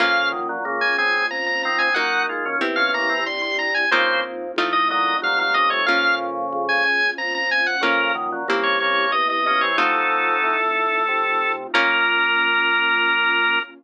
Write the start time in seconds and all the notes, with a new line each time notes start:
0.00 A#1 F2 C#3 A#3 C#4 F4 F5
0.32 F#2 D#3
0.49 A#2 F#3
0.65 C#2 C#3 A#3
0.81 G#5
0.98 D#3 C4 G#5
1.30 F2 A#5
1.46 A#5
1.63 D#3 C4 A#5
1.79 D#3 C4 G#5
1.94 D#2 F#3 A#3 D#4 F#4 F#5
2.29 G#3 F4
2.46 F3 C#4
2.61 E2 C4 E4 G4
2.76 F3 C#4 F5
2.94 C#3 A#3 A#5
3.09 E3 C4
3.26 G2 C6
3.42 C6
3.59 A#5
3.74 G#5
3.91 F2 C#3 A#3 C4 D#4 F4 C5
4.56 A1 A3 C4 D#4 F4
4.73 D#5
4.90 A#2 F#3 D#5
5.22 C2 A#2 F#3 F5
5.38 A#2 F#3 F5
5.54 C#3 A#3 D#5
5.70 C3 A3 C#5
5.86 A#1 F2 C#3 A#3 C#4 F4 F5
6.53 C#2
6.69 G#5
6.84 G#5
7.18 F2 A#5
7.35 A#5
7.51 G#5
7.66 F#5
7.81 A#1 F2 C#3 A#3 C#4 F4 A#4
8.15 F#2 D#3
8.32 A#2 F#3
8.48 C2 C#3 A#3 C4 E4 G4
8.63 C#5
8.80 C#3 A#3 C#5
9.12 E2 D#5
9.30 D#5
9.46 F3 C#4 D#5
9.61 E3 C4 C#5
9.77 F2 F#3 A3 C4 D#4 F4 A4
10.43 A2
11.08 C3
11.74 A#1 A#3 C#4 F4 A#4